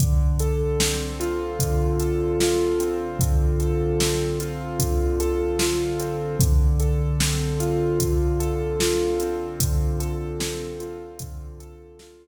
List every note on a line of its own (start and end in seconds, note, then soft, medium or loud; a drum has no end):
0.00 1.59 D3 medium
0.00 kick medium
0.00 closed hi-hat medium
0.40 2.00 A4 medium
0.40 closed hi-hat medium
0.80 2.80 C4 medium
0.80 snare loud
1.20 2.40 F4 medium
1.20 closed hi-hat medium
1.60 3.20 D3 medium
1.60 kick medium
1.60 closed hi-hat medium
2.00 3.59 A4 medium
2.00 closed hi-hat medium
2.40 4.40 F4 medium
2.40 snare medium
2.80 4.00 C4 medium
2.80 closed hi-hat medium
3.19 4.80 D3 medium
3.19 kick medium
3.19 closed hi-hat medium
3.60 5.20 A4 medium
3.60 closed hi-hat medium
4.00 6.00 C4 medium
4.00 snare medium
4.40 5.60 F4 medium
4.40 closed hi-hat medium
4.79 6.34 D3 medium
4.79 kick medium
4.79 closed hi-hat medium
5.20 6.35 A4 medium
5.20 closed hi-hat medium
5.59 6.37 F4 medium
5.59 snare medium
6.00 6.39 C4 medium
6.00 closed hi-hat medium
6.40 7.99 D3 medium
6.40 kick loud
6.40 closed hi-hat loud
6.80 8.39 A4 medium
6.80 closed hi-hat medium
7.20 9.20 C4 medium
7.20 snare loud
7.60 8.79 F4 medium
7.60 closed hi-hat medium
8.00 9.59 D3 medium
8.00 kick medium
8.00 closed hi-hat medium
8.40 9.99 A4 medium
8.40 closed hi-hat medium
8.80 10.79 F4 medium
8.80 snare medium
9.20 10.40 C4 medium
9.20 closed hi-hat medium
9.60 11.20 D3 medium
9.60 kick medium
9.60 closed hi-hat loud
10.00 11.60 A4 medium
10.00 closed hi-hat medium
10.40 12.27 C4 medium
10.40 snare loud
10.80 12.00 F4 medium
10.80 closed hi-hat medium
11.19 12.27 D3 medium
11.19 kick medium
11.19 closed hi-hat loud
11.60 12.27 A4 medium
11.60 closed hi-hat medium
11.99 12.27 F4 medium
11.99 snare medium